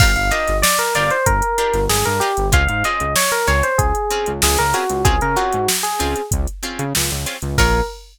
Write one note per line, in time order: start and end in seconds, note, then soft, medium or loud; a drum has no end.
0.00 0.16 G1 medium
0.00 0.11 D4 medium
0.00 0.11 F4 medium
0.00 0.11 G4 medium
0.00 0.11 A#4 medium
0.00 0.14 F5 medium
0.00 kick loud
0.00 crash loud
0.16 0.31 G1 medium
0.16 0.31 F5 medium
0.16 closed hi-hat medium
0.31 0.53 D4 medium
0.31 0.53 F4 medium
0.31 0.53 G4 medium
0.31 0.53 A#4 medium
0.31 0.57 D#5 medium
0.31 closed hi-hat loud
0.48 0.63 G1 medium
0.48 snare soft
0.48 closed hi-hat medium
0.62 0.77 D5 medium
0.62 snare loud
0.79 0.94 A#4 medium
0.79 closed hi-hat medium
0.95 1.10 G1 medium
0.95 1.17 D4 medium
0.95 1.17 F4 medium
0.95 1.17 G4 medium
0.95 1.17 A#4 medium
0.95 1.10 D5 medium
0.95 closed hi-hat medium
1.11 1.26 C5 medium
1.11 closed hi-hat medium
1.26 1.42 G1 medium
1.26 1.84 A#4 medium
1.26 kick loud
1.26 closed hi-hat loud
1.42 closed hi-hat medium
1.58 1.80 D4 medium
1.58 1.80 F4 medium
1.58 1.80 G4 medium
1.58 1.80 A#4 medium
1.58 closed hi-hat medium
1.74 1.88 G1 medium
1.74 snare soft
1.74 closed hi-hat medium
1.89 2.04 G1 medium
1.89 2.04 G#4 medium
1.89 snare loud
2.05 2.21 G2 medium
2.05 2.20 A#4 medium
2.05 closed hi-hat medium
2.20 2.32 D4 medium
2.20 2.32 F4 medium
2.20 2.47 G4 medium
2.20 2.32 G4 medium
2.20 2.32 A#4 medium
2.20 closed hi-hat medium
2.37 2.52 G1 medium
2.37 closed hi-hat medium
2.52 2.67 C#2 medium
2.52 2.63 C4 medium
2.52 2.63 C#4 medium
2.52 2.63 F4 medium
2.52 2.63 G#4 medium
2.52 2.68 F5 medium
2.52 kick loud
2.52 closed hi-hat loud
2.68 2.83 G#2 medium
2.68 2.83 F5 medium
2.68 closed hi-hat medium
2.84 3.06 C4 medium
2.84 3.06 C#4 medium
2.84 3.06 F4 medium
2.84 3.06 G#4 medium
2.84 3.13 D#5 medium
2.84 closed hi-hat medium
3.00 3.15 C#2 medium
3.00 closed hi-hat medium
3.16 3.31 C#5 medium
3.16 snare loud
3.31 3.47 A#4 medium
3.31 closed hi-hat medium
3.47 3.63 C#2 medium
3.47 3.69 C4 medium
3.47 3.69 C#4 medium
3.47 3.69 F4 medium
3.47 3.69 G#4 medium
3.47 3.63 C#5 medium
3.47 closed hi-hat medium
3.63 3.78 C5 medium
3.63 closed hi-hat medium
3.78 3.93 C#2 medium
3.78 4.31 G#4 medium
3.78 kick loud
3.78 closed hi-hat loud
3.95 closed hi-hat medium
4.11 4.33 C4 medium
4.11 4.33 C#4 medium
4.11 4.33 F4 medium
4.11 4.33 G#4 medium
4.11 closed hi-hat medium
4.26 4.42 C#2 medium
4.26 closed hi-hat medium
4.42 4.57 C#2 medium
4.42 4.58 G#4 medium
4.42 snare loud
4.58 4.74 C#2 medium
4.58 4.74 A#4 medium
4.58 closed hi-hat medium
4.73 4.84 C4 medium
4.73 4.84 C#4 medium
4.73 4.84 F4 medium
4.73 5.05 F#4 medium
4.73 4.84 G#4 medium
4.73 closed hi-hat medium
4.89 5.04 C#2 medium
4.89 closed hi-hat medium
5.05 5.20 C#2 medium
5.05 5.16 C4 medium
5.05 5.16 C#4 medium
5.05 5.16 F4 medium
5.05 5.20 G#4 medium
5.05 5.16 G#4 medium
5.05 kick loud
5.05 closed hi-hat loud
5.21 5.36 C#3 medium
5.21 5.37 A#4 medium
5.21 closed hi-hat medium
5.36 5.58 C4 medium
5.36 5.58 C#4 medium
5.36 5.58 F4 medium
5.36 5.67 F#4 medium
5.36 5.58 G#4 medium
5.36 closed hi-hat medium
5.53 5.68 G#2 medium
5.53 closed hi-hat medium
5.68 snare loud
5.83 6.22 G#4 medium
5.83 closed hi-hat medium
5.99 6.15 C#2 medium
5.99 6.21 C4 medium
5.99 6.21 C#4 medium
5.99 6.21 F4 medium
5.99 6.21 G#4 medium
5.99 closed hi-hat loud
6.16 closed hi-hat medium
6.31 6.47 C#2 medium
6.31 kick loud
6.31 closed hi-hat loud
6.47 closed hi-hat medium
6.63 6.85 C4 medium
6.63 6.85 C#4 medium
6.63 6.85 F4 medium
6.63 6.85 G#4 medium
6.63 closed hi-hat medium
6.79 6.93 C#3 medium
6.79 closed hi-hat medium
6.95 7.11 C#2 medium
6.95 snare loud
7.11 7.26 C#2 medium
7.11 snare soft
7.11 closed hi-hat medium
7.26 7.37 C4 medium
7.26 7.37 C#4 medium
7.26 7.37 F4 medium
7.26 7.37 G#4 medium
7.26 snare soft
7.26 closed hi-hat medium
7.42 7.57 C#2 medium
7.42 closed hi-hat medium
7.58 7.81 A#1 loud
7.58 7.80 F4 loud
7.58 7.80 G#4 medium
7.58 7.80 A#4 loud
7.58 7.80 C#5 loud
7.58 kick loud
7.58 crash loud